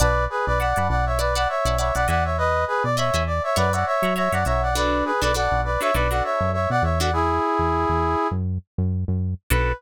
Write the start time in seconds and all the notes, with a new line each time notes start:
0.00 B1 B4 D5 F#5 A5 B5
0.30 G#4 B4
0.46 B1 B4 D5
0.59 D5 F#5 A5 B5
0.76 F#2 D5 F#5 A5 B5
0.89 B1 D5 F#5
1.06 C#5 E5
1.19 B4 D5 F#5 A5 B5
1.35 D5 F#5 A5 B5
1.49 C#5 E5
1.65 B1 D5 F#5 A5 B5
1.78 C#5 D5 E5 F#5 A5 B5
1.95 B1 D5 F#5 A5 B5
2.08 E2 D5 D#5 E5 F#5 G#5 B5
2.24 C#5 E5
2.38 B4 D#5
2.67 G#4 B4
2.84 B2 D5
2.97 C#5 D#5 E5 G#5 B5
3.14 E2 D#5 E5 G#5 B5
3.27 D5
3.43 C#5 E5
3.56 F#2 B4 C#5 D5 E5 F#5 A#5
3.73 C#5 D5 E5 F#5 A#5
3.86 C#5 E5
4.02 F#3 C#5 E5 F#5 A#5
4.16 C#5 E5 F#5 A#5
4.32 F#2 C#5 D5 E5 F#5 A#5
4.45 B1 C#5 E5 F#5 A#5
4.62 D5 F#5
4.75 D4 F#4 A4 B4 D5
5.05 G#4 B4
5.22 B1 D4 F#4 A4 B4 D5
5.34 D4 F#4 A4 B4 D5 F#5
5.51 B1
5.64 B4 D5
5.81 D4 F#4 A4 B4 C#5 E5
5.94 B1 D4 F#4 A4 B4 D5
6.11 D4 F#4 A4 B4 D5 F#5
6.24 C#5 E5
6.40 F#2
6.53 C#5 E5
6.70 B2 D5 F#5
6.83 E2 C#5 E5
7.00 D4 F#4 A4 B4 D5 F#5
7.13 E4 G#4
7.59 E2
7.89 E2
8.31 F#2
8.78 F#2
9.08 F#2
9.50 B1 D4 F#4 A4 B4